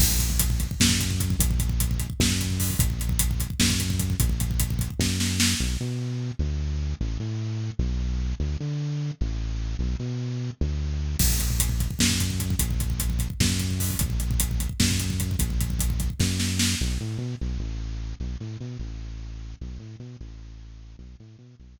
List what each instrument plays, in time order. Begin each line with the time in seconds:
0.00 synth bass 1 A#1, kick, crash
0.11 kick
0.19 kick, closed hi-hat
0.30 kick
0.40 kick, closed hi-hat
0.50 kick
0.60 kick, closed hi-hat
0.71 kick
0.80 synth bass 1 F#2, kick, snare
0.89 kick
1.00 kick, closed hi-hat
1.10 kick
1.20 kick, closed hi-hat
1.30 kick
1.39 synth bass 1 A#1, kick, closed hi-hat
1.51 kick
1.60 kick, closed hi-hat
1.69 kick
1.80 kick, closed hi-hat
1.91 kick
2.00 kick, closed hi-hat
2.10 kick
2.20 synth bass 1 F#2, kick, snare
2.30 kick
2.41 kick, closed hi-hat
2.50 kick
2.60 kick, open hi-hat
2.70 kick
2.79 synth bass 1 A#1, kick, closed hi-hat
2.90 kick
3.00 kick, closed hi-hat
3.09 kick
3.19 kick, closed hi-hat
3.31 kick
3.40 kick, closed hi-hat
3.50 kick
3.60 synth bass 1 F#2, kick, snare
3.70 kick
3.80 kick, closed hi-hat
3.90 kick
4.00 kick, closed hi-hat
4.10 kick
4.20 synth bass 1 A#1, kick, closed hi-hat
4.29 kick
4.40 kick, closed hi-hat
4.51 kick
4.60 kick, closed hi-hat
4.70 kick
4.79 kick, closed hi-hat
4.90 kick
4.99 synth bass 1 F#2, kick, snare
5.20 snare
5.40 snare
5.60 synth bass 1 B1
5.81 synth bass 1 B2
6.39 synth bass 1 D2
7.01 synth bass 1 A1
7.20 synth bass 1 A2
7.79 synth bass 1 B1
8.40 synth bass 1 D2
8.60 synth bass 1 D3
9.21 synth bass 1 A1
9.79 synth bass 1 B1
9.99 synth bass 1 B2
10.61 synth bass 1 D2
11.19 synth bass 1 A#1, kick, crash
11.30 kick
11.39 kick, closed hi-hat
11.50 kick
11.60 kick, closed hi-hat
11.69 kick
11.80 kick, closed hi-hat
11.91 kick
11.99 synth bass 1 F#2, kick, snare
12.10 kick
12.20 kick, closed hi-hat
12.30 kick
12.40 kick, closed hi-hat
12.50 kick
12.59 synth bass 1 A#1, kick, closed hi-hat
12.71 kick
12.80 kick, closed hi-hat
12.90 kick
13.00 kick, closed hi-hat
13.10 kick
13.19 kick, closed hi-hat
13.30 kick
13.40 synth bass 1 F#2, kick, snare
13.50 kick
13.60 kick, closed hi-hat
13.71 kick
13.80 kick, open hi-hat
13.90 kick
13.99 synth bass 1 A#1, kick, closed hi-hat
14.10 kick
14.20 kick, closed hi-hat
14.31 kick
14.40 kick, closed hi-hat
14.51 kick
14.60 kick, closed hi-hat
14.69 kick
14.80 synth bass 1 F#2, kick, snare
14.91 kick
15.00 kick, closed hi-hat
15.10 kick
15.20 kick, closed hi-hat
15.31 kick
15.39 synth bass 1 A#1, kick, closed hi-hat
15.50 kick
15.61 kick, closed hi-hat
15.70 kick
15.79 kick, closed hi-hat
15.90 kick
16.00 kick, closed hi-hat
16.10 kick
16.20 synth bass 1 F#2, kick, snare
16.40 snare
16.59 snare
16.81 synth bass 1 B1
17.00 synth bass 1 A2
17.18 synth bass 1 B2
17.41 synth bass 1 B1
17.59 synth bass 1 A1
18.20 synth bass 1 B1
18.40 synth bass 1 A2
18.61 synth bass 1 B2
18.79 synth bass 1 A1
19.61 synth bass 1 B1
19.79 synth bass 1 A2
20.00 synth bass 1 B2
20.21 synth bass 1 A1
20.99 synth bass 1 B1
21.20 synth bass 1 A2
21.39 synth bass 1 B2
21.60 synth bass 1 B1